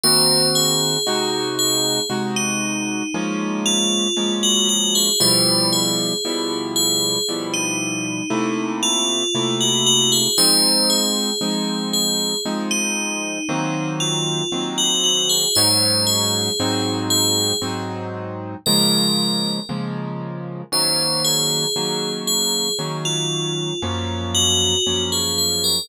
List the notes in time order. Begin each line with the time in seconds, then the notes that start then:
0.03 D#3 A#3 C4 F#4 C5
0.55 G#4
1.06 C3 G#3 D#4 F#4
1.59 G#4
2.09 C3 G#3 D#4 F#4
2.36 D#4
3.14 F3 G#3 A#3 C#4
3.66 F4
4.17 F3 G#3 A#3 C#4
4.43 F#4
4.69 F#4
4.95 G#4
5.20 B2 F3 G3 E4 C5
5.72 G#4
6.25 B2 F3 G3 E4
6.76 G#4
7.28 B2 F3 G3 E4
7.53 D#4
8.30 C3 A3 A#3 E4
8.83 F4
9.34 C3 A3 A#3 E4
9.60 F#4
9.86 F#4
10.12 G#4
10.38 F3 G#3 C4 D#4 C5
10.90 G#4
11.41 F3 G#3 C4 D#4
11.93 G#4
12.45 F3 G#3 C4 D#4
12.71 D#4
13.49 D#3 F#3 A#3 C4
14.00 F4
14.52 D#3 F#3 A#3 C4
14.78 F#4
15.04 F#4
15.29 G#4
15.55 G#2 F#3 C#4 D#4 C5
16.06 G#4
16.59 G#2 F#3 C4 D#4
17.10 G#4
17.62 G#2 F#3 C4 D#4
18.66 C#3 F3 G#3 A#3 A#4
19.69 C#3 F3 G#3 A#3
20.72 D#3 F#3 A#3 C#4 C5
21.24 G#4
21.76 D#3 F#3 A#3 C#4
22.27 G#4
22.79 D#3 F#3 A#3 C#4
23.05 F4
23.82 F#2 F3 A#3 C#4
24.34 F#4
24.86 F#2 F3 A#3 C#4
25.12 G#4
25.38 G#4
25.64 A#4